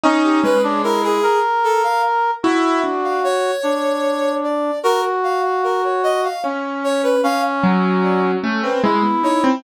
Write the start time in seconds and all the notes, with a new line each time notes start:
0.04 C#4 D#4
0.24 G4
0.43 G#3 B4
0.64 D4 C#5
0.84 E4 A#4
1.03 G#4
1.23 A#4
1.64 A4
1.83 F5
2.43 E4 F#4 E5
2.84 D4
3.04 F5
3.24 C#5
3.63 D4
4.43 D5
4.83 F#4 A#4
5.23 F5
5.44 F5
5.64 A#4
5.84 C#5
6.03 D#5
6.24 F5
6.44 C#4
6.84 C#5
7.03 B4
7.23 C#4 F5
7.63 F#3
8.03 D5
8.43 A3 C#4
8.63 C4 B4
8.84 G#3 E4
9.03 B3
9.23 D#4 C#5
9.44 C4